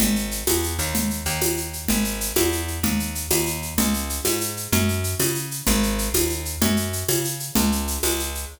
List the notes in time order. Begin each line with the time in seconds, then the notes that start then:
0.00 G#1, low conga, shaker
0.16 shaker
0.31 shaker
0.47 E2, tambourine, high conga, shaker
0.63 shaker
0.79 D#2, shaker
0.95 low conga, shaker
1.10 shaker
1.25 D#2, shaker
1.41 tambourine, high conga, shaker
1.57 shaker
1.73 shaker
1.88 G#1, low conga, shaker
2.04 shaker
2.21 shaker
2.36 E2, tambourine, high conga, shaker
2.52 shaker
2.68 shaker
2.83 D#2, low conga, shaker
3.00 shaker
3.15 shaker
3.31 D#2, tambourine, high conga, shaker
3.46 shaker
3.62 shaker
3.78 C#2, low conga, shaker
3.94 shaker
4.09 shaker
4.25 G#2, tambourine, high conga, shaker
4.41 shaker
4.57 shaker
4.72 F#2, low conga, shaker
4.88 shaker
5.04 shaker
5.19 C#3, tambourine, high conga, shaker
5.35 shaker
5.51 shaker
5.67 G#1, low conga, shaker
5.83 shaker
5.98 shaker
6.14 D#2, tambourine, high conga, shaker
6.30 shaker
6.45 shaker
6.62 F#2, low conga, shaker
6.77 shaker
6.93 shaker
7.08 C#3, tambourine, high conga, shaker
7.25 shaker
7.40 shaker
7.55 C#2, low conga, shaker
7.72 shaker
7.88 shaker
8.03 C#2, tambourine, high conga, shaker
8.19 shaker
8.35 shaker